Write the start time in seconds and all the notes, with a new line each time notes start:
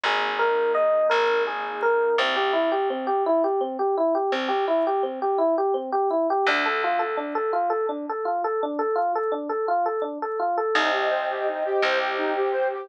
0.04 G#1 A#3 D#4 G#4
0.39 A#4
0.75 D#5
1.10 G#1 A#4
1.47 G#4
1.82 A#4
2.18 C2 C4
2.36 G4
2.53 E4
2.72 G4
2.90 C4
3.07 G4
3.26 E4
3.44 G4
3.61 C4
3.79 G4
3.97 E4
4.15 G4
4.32 C2 C4
4.48 G4
4.68 E4
4.87 G4
5.03 C4
5.22 G4
5.38 E4
5.58 G4
5.74 C4
5.92 G4
6.11 E4
6.30 G4
6.47 D2 D4
6.66 A4
6.84 F4
6.99 A4
7.17 D4
7.35 A4
7.53 F4
7.70 A4
7.89 D4
8.09 A4
8.25 F4
8.44 A4
8.63 D4
8.79 A4
8.96 F4
9.15 A4
9.32 D4
9.49 A4
9.68 F4
9.86 A4
10.02 D4
10.22 A4
10.39 F4
10.58 A4
10.74 C2 D#4 C5 D#5 G5
10.92 G4
11.10 C5
11.30 G4
11.47 D#4
11.65 G4
11.82 C2 G4 C5 G5
12.00 G4
12.18 D#4
12.36 G4
12.52 C5
12.74 G4